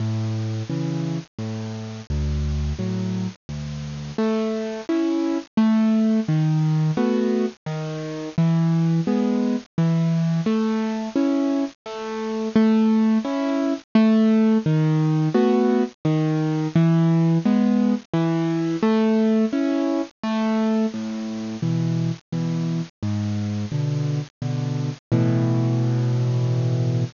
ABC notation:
X:1
M:3/4
L:1/8
Q:1/4=86
K:A
V:1 name="Acoustic Grand Piano"
A,,2 [C,E,]2 A,,2 | D,,2 [A,,F,]2 D,,2 | A,2 [CE]2 A,2 | ^D,2 [A,B,F]2 D,2 |
E,2 [G,B,]2 E,2 | A,2 [CE]2 A,2 | A,2 [CE]2 A,2 | ^D,2 [A,B,F]2 D,2 |
E,2 [G,B,]2 E,2 | A,2 [CE]2 A,2 | A,,2 [B,,E,]2 [B,,E,]2 | G,,2 [B,,D,]2 [B,,D,]2 |
[A,,B,,E,]6 |]